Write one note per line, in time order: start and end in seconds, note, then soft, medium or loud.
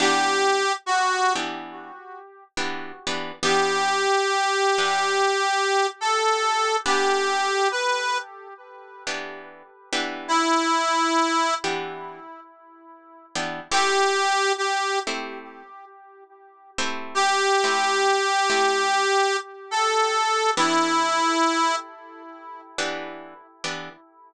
0.00 0.64 E3 loud
0.00 0.64 B3 medium
0.00 0.64 D4 loud
0.00 0.64 G4 medium
0.00 0.73 G4 loud
0.86 1.33 F#4 medium
1.36 1.91 E3 medium
1.36 1.91 B3 medium
1.36 1.91 D4 medium
1.36 1.91 G4 medium
2.57 2.92 E3 medium
2.57 2.92 B3 medium
2.57 2.92 D4 medium
2.57 2.92 G4 medium
3.07 3.32 E3 medium
3.07 3.32 B3 medium
3.07 3.32 D4 medium
3.07 3.32 G4 medium
3.43 4.07 E3 medium
3.43 4.07 B3 loud
3.43 4.07 D4 medium
3.43 4.07 G4 medium
3.43 5.87 G4 loud
4.78 5.34 E3 medium
4.78 5.34 B3 medium
4.78 5.34 D4 medium
4.78 5.34 G4 medium
6.01 6.76 A4 medium
6.86 7.50 E3 medium
6.86 7.50 B3 medium
6.86 7.50 D4 loud
6.86 7.50 G4 medium
6.86 7.68 G4 loud
7.71 8.18 B4 medium
9.07 9.63 E3 medium
9.07 9.63 B3 medium
9.07 9.63 D4 medium
9.07 9.63 G4 medium
9.93 10.93 E3 loud
9.93 10.93 B3 loud
9.93 10.93 D4 loud
9.93 10.93 G4 medium
10.28 11.54 E4 loud
11.64 12.20 E3 medium
11.64 12.20 B3 medium
11.64 12.20 D4 medium
11.64 12.20 G4 medium
13.35 13.61 E3 medium
13.35 13.61 B3 medium
13.35 13.61 D4 loud
13.35 13.61 G4 medium
13.71 14.36 A3 loud
13.71 14.36 C4 loud
13.71 14.36 E4 loud
13.71 14.36 G4 loud
13.71 14.53 G4 loud
14.58 14.99 G4 medium
15.07 15.63 A3 medium
15.07 15.63 C4 medium
15.07 15.63 E4 medium
15.07 15.63 G4 medium
16.78 17.49 A3 loud
16.78 17.49 C4 medium
16.78 17.49 E4 loud
16.78 17.49 G4 medium
17.15 19.37 G4 loud
17.64 18.20 A3 medium
17.64 18.20 C4 medium
17.64 18.20 E4 medium
17.64 18.20 G4 medium
18.50 19.06 A3 medium
18.50 19.06 C4 medium
18.50 19.06 E4 medium
18.50 19.06 G4 loud
19.71 20.51 A4 loud
20.57 21.21 E3 loud
20.57 21.21 B3 loud
20.57 21.21 D4 loud
20.57 21.76 E4 loud
20.57 21.21 G4 medium
22.78 23.34 E3 medium
22.78 23.34 B3 medium
22.78 23.34 D4 medium
22.78 23.34 G4 medium
23.64 23.89 E3 medium
23.64 23.89 B3 medium
23.64 23.89 D4 medium
23.64 23.89 G4 medium